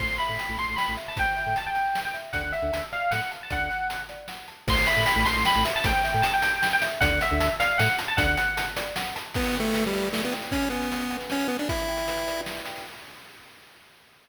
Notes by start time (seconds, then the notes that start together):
0.00 A1 C5 C6, kick, crash
0.09 A1
0.18 E5 B5, closed hi-hat
0.29 A2
0.39 G5, closed hi-hat
0.49 A1
0.58 A1 A5 C6, closed hi-hat
0.68 A1
0.76 G5 B5, snare
0.88 A1
0.97 E5, closed hi-hat
1.08 A5
1.17 A1 C5 G5, kick, closed hi-hat
1.36 E5, closed hi-hat
1.46 A2
1.56 G5 A5, closed hi-hat
1.66 G5
1.75 A5, closed hi-hat
1.95 G5, snare
2.05 G5
2.14 E5, closed hi-hat
2.33 D2 D5 F#5, kick, closed hi-hat
2.43 D2
2.52 E5 F#5, closed hi-hat
2.62 D2
2.73 D2 A5, closed hi-hat
2.92 D5 F5, closed hi-hat
3.11 A2 F#5, snare
3.31 A5, closed hi-hat
3.43 A5
3.50 D2 D5 F#5, kick, closed hi-hat
3.61 D2
3.70 F#5, closed hi-hat
3.90 A5, closed hi-hat
4.09 D5, closed hi-hat
4.28 F#5, snare
4.48 A5, closed hi-hat
4.68 A1 C5 C6, kick, crash
4.77 A1
4.86 E5 B5, closed hi-hat
4.96 A2
5.06 G5, closed hi-hat
5.16 A1
5.25 A1 A5 C6, closed hi-hat
5.36 A1
5.45 G5 B5, snare
5.56 A1
5.65 E5, closed hi-hat
5.76 A5
5.84 A1 C5 G5, kick, closed hi-hat
6.04 E5, closed hi-hat
6.14 A2
6.22 G5 A5, closed hi-hat
6.34 G5
6.42 A5, closed hi-hat
6.62 G5, snare
6.73 G5
6.82 E5, closed hi-hat
7.01 D2 D5 F#5, kick, closed hi-hat
7.11 D2
7.21 E5 F#5, closed hi-hat
7.31 D2
7.40 D2 A5, closed hi-hat
7.60 D5 F5, closed hi-hat
7.78 A2 F#5, snare
7.99 A5, closed hi-hat
8.08 A5
8.17 D2 D5 F#5, kick, closed hi-hat
8.27 D2
8.37 F#5, closed hi-hat
8.57 A5, closed hi-hat
8.76 D5, closed hi-hat
8.96 F#5, snare
9.16 A5, closed hi-hat
9.34 B3 E4, kick, crash
9.44 closed hi-hat
9.55 G5, closed hi-hat
9.60 A3
9.65 closed hi-hat
9.74 B4, closed hi-hat
9.84 G3, closed hi-hat
9.93 D5, closed hi-hat
10.03 closed hi-hat
10.13 A3 E4, snare
10.23 B3, closed hi-hat
10.32 G5, closed hi-hat
10.42 closed hi-hat
10.51 C#4, kick, closed hi-hat
10.62 closed hi-hat
10.70 B3 G#5, closed hi-hat
10.82 closed hi-hat
10.91 B4, closed hi-hat
11.00 closed hi-hat
11.10 F#5, closed hi-hat
11.21 closed hi-hat
11.30 C#4, snare
11.40 closed hi-hat
11.48 B3 G#5, closed hi-hat
11.59 D4, closed hi-hat
11.69 E4, kick, closed hi-hat
11.79 closed hi-hat
11.88 G5, closed hi-hat
11.97 closed hi-hat
12.08 B4, closed hi-hat
12.17 closed hi-hat
12.27 D5, closed hi-hat
12.37 closed hi-hat
12.46 E4, snare
12.57 closed hi-hat
12.66 G5, closed hi-hat
12.76 open hi-hat